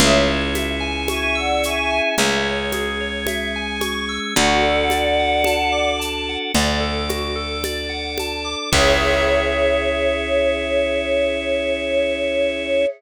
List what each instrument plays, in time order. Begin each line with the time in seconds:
0.00 electric bass (finger) C#2, drawbar organ C#4 E4 G#4, tubular bells G#4, choir aahs C#5 E5, low conga, shaker
0.28 tubular bells C#5
0.55 tubular bells E5, high conga, shaker
0.80 tubular bells G#5
1.08 choir aahs E5 G#5, tubular bells C#6, high conga, shaker
1.35 choir aahs D5 F#5, tubular bells E6
1.63 choir aahs E5 G#5, tubular bells C#6, shaker
1.90 tubular bells G#5
2.18 electric bass (finger) C#2, drawbar organ G#3 C#4 G#4, tubular bells E5, low conga, shaker
2.45 tubular bells C#5
2.72 tubular bells G#4, high conga, shaker
3.01 tubular bells C#5
3.27 tubular bells E5, high conga, shaker
3.56 tubular bells G#5
3.81 tubular bells C#6, high conga, shaker
4.09 tubular bells E6
4.35 electric bass (finger) D2, drawbar organ D4 F#4 A4, tubular bells F#4, choir aahs D5 F#5, low conga, shaker
4.62 tubular bells A4
4.90 tubular bells D5, high conga, shaker
5.20 tubular bells F#5
5.44 tubular bells A5, high conga, shaker
5.72 tubular bells D6
6.00 tubular bells A5, shaker
6.29 tubular bells F#5
6.54 electric bass (finger) D2, drawbar organ D4 A4 D5, tubular bells D5, low conga, shaker
6.80 tubular bells A4
7.09 tubular bells F#4, high conga, shaker
7.36 tubular bells A4
7.64 tubular bells D5, high conga, shaker
7.90 tubular bells F#5
8.18 tubular bells A5, high conga, shaker
8.45 tubular bells D6
8.72 electric bass (finger) C#2, drawbar organ C#4 E4 G#4, tubular bells G#4 C#5 E5, choir aahs C#5, kick, crash